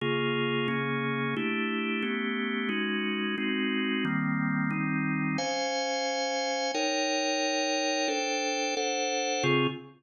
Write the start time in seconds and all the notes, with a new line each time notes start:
0.01 C#3 A#3 F4 G#4
0.68 C#3 A#3 C#4 G#4
1.36 A3 D4 E4 G4
2.02 A3 B3 C#4 G4
2.69 G#3 C#4 D#4 F#4
3.38 G#3 C4 D#4 F#4
4.05 D#3 G3 A#3 C4
4.71 D#3 G3 C4 D#4
5.38 C#4 C5 F5 G#5
6.74 D#4 A#4 C#5 G5
8.08 D4 A4 C5 G5
8.77 D4 A4 C5 F#5
9.43 C#3 C4 F4 G#4